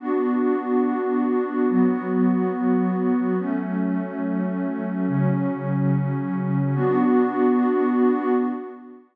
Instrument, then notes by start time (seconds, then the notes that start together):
pad 2 (warm)
0.00 B3 D4 F#4
1.69 F#3 B3 F#4
3.39 F#3 A3 C#4
5.07 C#3 F#3 C#4
6.75 B3 D4 F#4